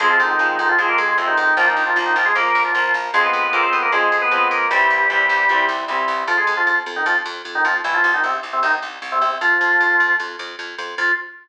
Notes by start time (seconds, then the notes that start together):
0.00 F2 F3 G#3 C4 G#4
0.10 F3 F4
0.20 F2 D#3 D#4
0.29 D#3 D#4
0.39 F2 F3 G#3 C4
0.59 F2 D#3 D#4
0.69 F3 F4
0.78 F2 F3 G#3 C4 G#4
0.88 A#3 A#4
0.98 F2 G#3 G#4
1.08 G#3 G#4
1.17 F2 C3 F3 G#3 C4
1.27 D#3 D#4
1.37 F2 D#3 D#4
1.57 A#1 F3 A#3 F4
1.67 D#3 D#4
1.76 A#1
1.86 F3 F4
1.96 A#1 F3 A#3
2.06 D#3 D#4
2.16 A#1 F3 F4
2.25 G#3 G#4
2.35 A#1 F3 A#3 A#4
2.55 A#1
2.65 F3 F4
2.74 A#1 F3 A#3
2.94 A#1
3.14 F2 F3 G#3 C4 G#4
3.24 B3 B4
3.33 F2
3.43 B3 B4
3.53 F2 F3 G#3 A#3 C4 A#4
3.63 C4 C5
3.73 F2 B3 B4
3.82 A#3 A#4
3.92 F2 F3 G#3 C4 G#4
4.12 F2
4.22 B3 B4
4.31 F2 F3 G#3 C4
4.51 F2 A#3 A#4
4.71 C2 E3 G3 C4 G4
4.90 C2
5.10 C2 E3 G3 C4
5.29 C2
5.49 C2 E3 G3 C4
5.69 C2
5.88 C2 E3 G3 C4
6.08 C2
6.28 F2 F3 F4
6.37 G#3 G#4
6.47 F2
6.57 F3 F4
6.67 F2 F3 F4
6.86 F2
6.96 D#3 D#4
7.06 F2 F3 F4
7.25 F2
7.45 F2
7.55 D#3 D#4
7.65 F2 F3 F4
7.84 C2 E3 E4
7.94 F3 F4
8.04 C2
8.14 D#3 D#4
8.24 C2 C3 C4
8.43 C2
8.53 C3 C4
8.63 C2 D#3 D#4
8.82 C2
9.02 C2
9.12 C3 C4
9.21 C2 C3 C4
9.41 F2 F3 F4
9.61 F2
9.80 F2
10.00 F2
10.20 F2
10.39 F2
10.59 F2
10.78 F2
10.98 F2 F4